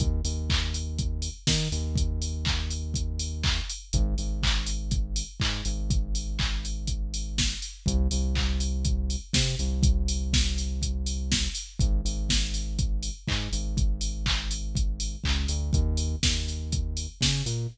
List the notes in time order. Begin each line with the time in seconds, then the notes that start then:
0.00 D#2, kick, closed hi-hat
0.24 D#2, open hi-hat
0.50 kick, clap
0.74 open hi-hat
0.98 kick, closed hi-hat
1.22 open hi-hat
1.47 D#3, kick, snare
1.72 D#2, open hi-hat
1.95 kick, closed hi-hat
2.22 open hi-hat
2.45 kick, clap
2.70 open hi-hat
2.94 kick, closed hi-hat
3.19 open hi-hat
3.44 kick, clap
3.70 open hi-hat
3.93 G#1, kick, closed hi-hat
4.18 G#1, open hi-hat
4.43 kick, clap
4.66 open hi-hat
4.91 kick, closed hi-hat
5.16 open hi-hat
5.40 G#2, kick, clap
5.65 G#1, open hi-hat
5.90 kick, closed hi-hat
6.15 open hi-hat
6.39 kick, clap
6.65 open hi-hat
6.87 kick, closed hi-hat
7.14 open hi-hat
7.38 kick, snare
7.62 open hi-hat
7.86 C2, kick, closed hi-hat
8.11 C2, open hi-hat
8.35 kick, clap
8.60 open hi-hat
8.85 kick, closed hi-hat
9.10 open hi-hat
9.33 C3, kick, snare
9.59 C2, open hi-hat
9.83 kick, closed hi-hat
10.08 open hi-hat
10.33 kick, snare
10.58 open hi-hat
10.82 kick, closed hi-hat
11.06 open hi-hat
11.32 kick, snare
11.55 open hi-hat
11.79 G#1, kick, closed hi-hat
12.05 G#1, open hi-hat
12.29 kick, snare
12.54 open hi-hat
12.79 kick, closed hi-hat
13.03 open hi-hat
13.28 G#2, kick, clap
13.52 G#1, open hi-hat
13.77 kick, closed hi-hat
14.01 open hi-hat
14.26 kick, clap
14.51 open hi-hat
14.75 kick, closed hi-hat
15.00 open hi-hat
15.24 C#2, kick, clap
15.48 D2, open hi-hat
15.73 D#2, kick, closed hi-hat
15.97 open hi-hat
16.23 D#2, kick, snare
16.48 open hi-hat
16.72 kick, closed hi-hat
16.97 open hi-hat
17.21 C#3, kick, snare
17.46 A#2, open hi-hat